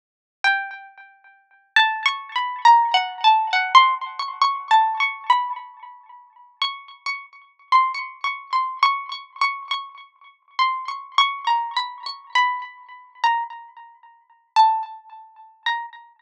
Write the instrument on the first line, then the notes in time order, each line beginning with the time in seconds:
pizzicato strings
0.44 G5
1.76 A5
2.06 C#6
2.35 B5
2.65 A#5
2.94 F#5
3.24 A5
3.53 F#5
3.75 C6
4.19 C#6
4.41 C#6
4.71 A5
5.00 C#6
5.30 B5
6.61 C#6
7.06 C#6
7.72 C6
7.94 C#6
8.24 C#6
8.53 C6
8.83 C#6
9.12 C#6
9.41 C#6
9.71 C#6
10.59 C6
10.88 C#6
11.18 C#6
11.47 A#5
11.76 B5
12.06 C#6
12.35 B5
13.23 A#5
14.56 A5
15.66 A#5